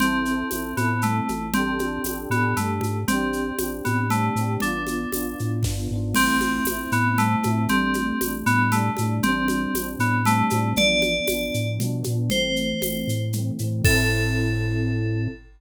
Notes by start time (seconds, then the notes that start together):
0.00 A1 C4 E4, low conga, shaker
0.04 A4
0.25 C4 E4, shaker
0.31 A4
0.51 A1 C4 E4, tambourine, high conga, shaker
0.55 A4
0.77 A2 B3 C4 E4, high conga, shaker
0.81 A4
1.02 A3, low conga, shaker
1.29 A1, high conga, shaker
1.54 C4 D4 G4, low conga, shaker
1.59 A4
1.79 D4 G4, high conga, shaker
1.84 A4
2.04 A1 D4 G4, tambourine, high conga, shaker
2.10 A4
2.30 A2 B3 D4, high conga, shaker
2.34 G4 A4
2.56 G2 A3, low conga, shaker
2.81 G#2, high conga, shaker
3.08 A1 C4 D4, low conga, shaker
3.12 G4
3.33 shaker
3.58 A1 C4 D4, tambourine, high conga, shaker
3.63 G4
3.85 A2 B3, high conga, shaker
4.10 A3 C4 D4, low conga, shaker
4.15 G4
4.35 A2 C4 D4, shaker
4.41 G4
4.60 A1 B3 D4, low conga, shaker
4.66 F4
4.87 high conga, shaker
5.12 A1 B3 D4, tambourine, high conga, shaker
5.16 F4
5.39 A2, shaker
5.63 G2 B3 D4, kick, snare
5.69 F4
5.91 G#2 B3 D4
5.95 F4
6.14 A1 A3 C4, crash, low conga, shaker
6.19 E4
6.41 high conga, shaker
6.65 A1 A3, tambourine, high conga, shaker
6.69 C4 E4
6.92 A2 B3, shaker
7.18 A3 C4, low conga, shaker
7.23 E4
7.43 A2 A3 C4, high conga, shaker
7.47 E4
7.68 A1 G3 A3 C4, low conga, shaker
7.74 D4
7.94 high conga, shaker
8.21 A1 G3 A3, tambourine, high conga, shaker
8.26 D4
8.46 A2 B3, shaker
8.72 G3 A3, low conga, shaker
8.76 D4
8.97 A2 G3 A3, high conga, shaker
9.02 D4
9.23 A1 G3 C4, low conga, shaker
9.29 D4
9.48 high conga, shaker
9.74 A1 G3 C4, tambourine, high conga, shaker
9.79 D4
9.99 A2 B3, shaker
10.25 G3 A3 C4, low conga, shaker
10.29 D4
10.50 A2 G3 C4, high conga, shaker
10.54 D4
10.76 A1 F3 B3 D5, low conga, shaker
10.81 D4
11.02 high conga, shaker
11.27 A1 F3 B3, tambourine, high conga, shaker
11.33 D4
11.54 A2, shaker
11.79 B2 F3 B3, low conga, shaker
11.84 D4
12.04 A#2 F3 B3, high conga, shaker
12.10 D4
12.30 A1 E3 A3 C5, low conga, shaker
12.36 C4
12.56 shaker
12.81 A1 E3 A3, tambourine, high conga, shaker
12.85 C4
13.07 A2, shaker
13.33 E3 A3, low conga, shaker
13.38 C4
13.59 A2 E3 A3, shaker
13.64 C4
13.84 A2 C4 E4 A4, kick, crash
13.89 A4